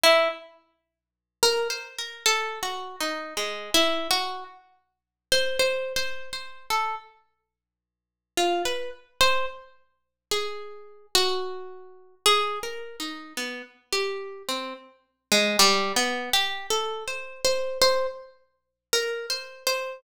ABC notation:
X:1
M:6/4
L:1/16
Q:1/4=54
K:none
V:1 name="Pizzicato Strings"
E z4 ^A c A (3=A2 ^F2 ^D2 (3^G,2 E2 F2 z3 c (3c2 c2 c2 | A z5 F B z c z3 ^G3 ^F4 (3G2 ^A2 ^D2 | B, z G2 C z2 ^G, (3=G,2 B,2 G2 (3A2 c2 c2 c z3 (3^A2 c2 c2 |]